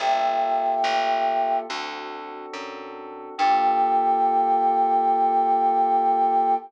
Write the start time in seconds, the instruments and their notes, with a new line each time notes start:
0.00 electric bass (finger) G1, electric piano 2 A#3 F4 G4 A4, flute E5 G5
0.84 electric bass (finger) A1
1.69 electric bass (finger) D2, electric piano 2 C4 D4 F#4 A4
2.54 electric bass (finger) F#2
3.38 electric bass (finger) G2, electric piano 2 A#3 F4 G4 A4, flute G5